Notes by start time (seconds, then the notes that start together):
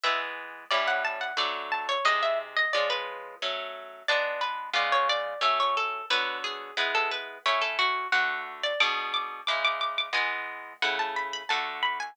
0.04 E3 G#3 B3 E5
0.71 A2 G3 C#4 E4 D5
0.87 F#5
1.05 A5
1.21 F#5
1.37 D3 F#3 A3 D5
1.72 A5
1.89 C#5
2.05 C3 G#3 D#4 D#5
2.23 E5
2.57 D#5
2.73 F3 G#3 C#4 D5
2.90 B4
3.42 F#3 A3 C#4
4.08 G#3 B3 D4 D5
4.41 B4
4.73 C#3 G#3 B3 F4 D5
4.92 C#5
5.09 D5
5.41 F#3 A3 C#4 E5
5.60 C#5
5.77 A4
6.10 D3 F#3 B3 B4
6.44 G#4
6.77 G#3 B3 E4 B4
6.95 A4
7.11 B4
7.46 A3 C#4 E4 C#5
7.62 A4
7.79 F#4
8.12 D3 A3 F#4 F#5
8.63 D5
8.80 B2 G#3 D4 D6
9.14 D6
9.47 C#3 G#3 E4 D6
9.65 D6
9.81 D6
9.98 D6
10.13 E3 G#3 B3 G#5
10.82 C#3 A3 E4 F#5
10.99 A5
11.16 B5
11.33 B5
11.49 D3 A3 F#4 A5
11.83 B5
12.00 G#5